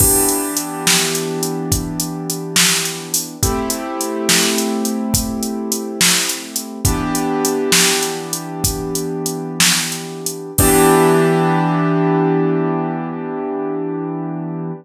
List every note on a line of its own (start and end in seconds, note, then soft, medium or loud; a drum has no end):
0.00 3.36 E3 medium
0.00 3.36 B3 medium
0.00 3.36 D4 medium
0.00 3.36 G4 medium
0.00 kick loud
0.00 crash loud
0.29 closed hi-hat medium
0.57 closed hi-hat medium
0.87 snare loud
1.15 closed hi-hat medium
1.43 closed hi-hat medium
1.72 kick medium
1.72 closed hi-hat loud
2.00 closed hi-hat medium
2.30 closed hi-hat medium
2.56 snare loud
2.85 closed hi-hat medium
3.14 open hi-hat medium
3.43 6.79 A3 medium
3.43 6.79 C4 medium
3.43 6.79 E4 medium
3.43 6.79 G4 medium
3.43 kick loud
3.43 closed hi-hat loud
3.70 closed hi-hat medium
4.01 closed hi-hat medium
4.29 snare loud
4.58 closed hi-hat medium
4.85 closed hi-hat medium
5.14 kick loud
5.14 closed hi-hat loud
5.43 closed hi-hat medium
5.72 closed hi-hat medium
6.01 snare loud
6.29 closed hi-hat medium
6.56 closed hi-hat medium
6.85 10.51 E3 medium
6.85 10.51 B3 medium
6.85 10.51 D4 medium
6.85 10.51 G4 medium
6.85 kick loud
6.85 closed hi-hat loud
7.15 closed hi-hat medium
7.45 closed hi-hat medium
7.72 snare loud
8.03 closed hi-hat medium
8.33 closed hi-hat medium
8.64 kick loud
8.64 closed hi-hat loud
8.95 closed hi-hat medium
9.26 closed hi-hat medium
9.60 snare loud
9.92 closed hi-hat medium
10.26 closed hi-hat medium
10.58 14.72 E3 loud
10.58 14.72 B3 medium
10.58 14.72 D4 loud
10.58 14.72 G4 loud
10.58 kick loud
10.58 crash loud